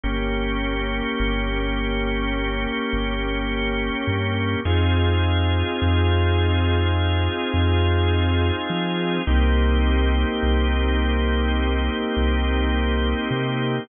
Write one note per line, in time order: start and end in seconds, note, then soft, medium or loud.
0.04 1.02 G1 loud
0.04 4.61 A#3 medium
0.04 4.61 C#4 medium
0.04 4.61 G4 medium
1.20 2.67 G1 loud
2.93 3.91 G1 loud
4.07 4.56 G2 loud
4.65 5.63 F2 loud
4.65 9.22 C4 medium
4.65 9.22 D#4 medium
4.65 9.22 F4 medium
4.65 9.22 G#4 medium
5.82 7.29 F2 loud
7.54 8.52 F2 loud
8.70 9.19 F3 loud
9.27 10.25 C2 loud
9.27 13.84 A#3 medium
9.27 13.84 C4 medium
9.27 13.84 D#4 medium
9.27 13.84 G4 medium
10.43 11.90 C2 loud
12.17 13.15 C2 loud
13.31 13.80 C3 medium